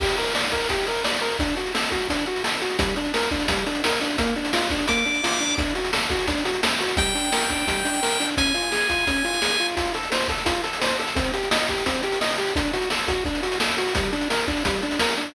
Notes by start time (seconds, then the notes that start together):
0.00 G4, kick, crash
0.09 closed hi-hat
0.18 A#4, closed hi-hat
0.26 closed hi-hat
0.35 D5, snare
0.43 closed hi-hat
0.52 A#4, kick, closed hi-hat
0.60 closed hi-hat
0.69 G4, kick, closed hi-hat
0.78 closed hi-hat
0.87 A#4, closed hi-hat
0.95 closed hi-hat
1.04 D5, snare
1.14 closed hi-hat
1.22 A#4, closed hi-hat
1.31 closed hi-hat
1.39 D4, kick, closed hi-hat
1.48 closed hi-hat
1.57 F#4, closed hi-hat
1.66 closed hi-hat
1.75 A4, snare
1.83 closed hi-hat
1.92 F#4, kick, closed hi-hat
2.00 closed hi-hat
2.09 D4, kick, closed hi-hat
2.19 closed hi-hat
2.26 F#4, closed hi-hat
2.36 closed hi-hat
2.44 A4, snare
2.53 closed hi-hat
2.61 F#4, closed hi-hat
2.70 closed hi-hat
2.79 G3, kick, closed hi-hat
2.88 closed hi-hat
2.96 D4, closed hi-hat
3.05 closed hi-hat
3.14 A#4, snare
3.23 closed hi-hat
3.31 D4, kick, closed hi-hat
3.40 closed hi-hat
3.48 G3, kick, closed hi-hat
3.57 closed hi-hat
3.66 D4, closed hi-hat
3.75 closed hi-hat
3.84 A#4, snare
3.92 closed hi-hat
4.01 D4, closed hi-hat
4.10 closed hi-hat
4.18 A#3, kick, closed hi-hat
4.27 closed hi-hat
4.36 D4, closed hi-hat
4.45 closed hi-hat
4.53 F4, snare
4.62 closed hi-hat
4.70 D4, kick, closed hi-hat
4.79 closed hi-hat
4.88 A#3 D6, kick, closed hi-hat
4.97 closed hi-hat
5.05 D4, closed hi-hat
5.14 closed hi-hat
5.23 F4, snare
5.32 closed hi-hat
5.40 D4, closed hi-hat
5.49 closed hi-hat
5.58 D4, kick, closed hi-hat
5.67 closed hi-hat
5.75 F#4, closed hi-hat
5.84 closed hi-hat
5.93 A4, snare
6.01 closed hi-hat
6.10 F#4, kick, closed hi-hat
6.19 closed hi-hat
6.27 D4, kick, closed hi-hat
6.37 closed hi-hat
6.45 F#4, closed hi-hat
6.54 closed hi-hat
6.63 A4, snare
6.72 closed hi-hat
6.80 F#4, closed hi-hat
6.89 closed hi-hat
6.97 G3 G5, kick, closed hi-hat
7.06 closed hi-hat
7.15 D4, closed hi-hat
7.24 closed hi-hat
7.32 A#4, snare
7.41 closed hi-hat
7.50 D4, kick, closed hi-hat
7.59 closed hi-hat
7.67 G3, kick, closed hi-hat
7.77 closed hi-hat
7.85 D4, closed hi-hat
7.94 closed hi-hat
8.03 A#4, snare
8.12 closed hi-hat
8.20 D4, closed hi-hat
8.29 closed hi-hat
8.37 C#4 G#5, kick, closed hi-hat
8.46 closed hi-hat
8.54 F4, closed hi-hat
8.63 closed hi-hat
8.72 G#4, snare
8.81 closed hi-hat
8.89 F4, kick, closed hi-hat
8.99 closed hi-hat
9.07 C#4, kick, closed hi-hat
9.16 closed hi-hat
9.24 F4, closed hi-hat
9.33 closed hi-hat
9.42 G#4, snare
9.60 F4, closed hi-hat
9.69 closed hi-hat
9.77 F4, kick, closed hi-hat
9.85 closed hi-hat
9.94 A4, closed hi-hat
10.03 closed hi-hat
10.12 C5, snare
10.21 closed hi-hat
10.28 A4, kick, closed hi-hat
10.38 closed hi-hat
10.46 F4, kick, closed hi-hat
10.55 closed hi-hat
10.64 A4, closed hi-hat
10.73 closed hi-hat
10.81 C5, snare
10.90 closed hi-hat
10.99 A4, closed hi-hat
11.08 closed hi-hat
11.16 C4, kick, closed hi-hat
11.25 closed hi-hat
11.34 G4, closed hi-hat
11.43 closed hi-hat
11.51 D#5, snare
11.59 closed hi-hat
11.68 G4, kick, closed hi-hat
11.78 closed hi-hat
11.86 C4, kick, closed hi-hat
11.94 closed hi-hat
12.03 G4, closed hi-hat
12.12 closed hi-hat
12.21 D#5, snare
12.30 closed hi-hat
12.38 G4, closed hi-hat
12.47 closed hi-hat
12.56 D4, kick, closed hi-hat
12.65 closed hi-hat
12.73 F#4, closed hi-hat
12.82 closed hi-hat
12.90 A4, snare
12.99 closed hi-hat
13.08 F#4, kick, closed hi-hat
13.25 D4, kick, closed hi-hat
13.35 closed hi-hat
13.43 F#4, closed hi-hat
13.52 closed hi-hat
13.60 A4, snare
13.70 closed hi-hat
13.78 F#4, closed hi-hat
13.87 closed hi-hat
13.95 G3, kick, closed hi-hat
14.04 closed hi-hat
14.13 D4, closed hi-hat
14.21 closed hi-hat
14.30 A#4, snare
14.39 closed hi-hat
14.48 D4, kick, closed hi-hat
14.57 closed hi-hat
14.65 G3, kick, closed hi-hat
14.74 closed hi-hat
14.82 D4, closed hi-hat
14.91 closed hi-hat
14.99 A#4, snare
15.09 closed hi-hat
15.17 D4, closed hi-hat
15.26 closed hi-hat